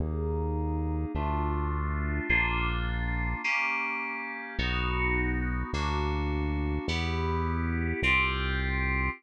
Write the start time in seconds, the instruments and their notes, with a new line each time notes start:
0.00 synth bass 1 D#2, electric piano 2 A#3 D#4 G#4
1.15 synth bass 1 D2, electric piano 2 A3 D4 F4
2.29 synth bass 1 A#1, electric piano 2 A#3 D4 F4
3.44 electric piano 2 A#3 C#4 G4
4.59 synth bass 1 B1, electric piano 2 B3 D#4 F#4
5.73 synth bass 1 D2, electric piano 2 A#3 D4 F#4
6.88 synth bass 1 E2, electric piano 2 B3 E4 G4
8.02 synth bass 1 C2, electric piano 2 C4 F4 G4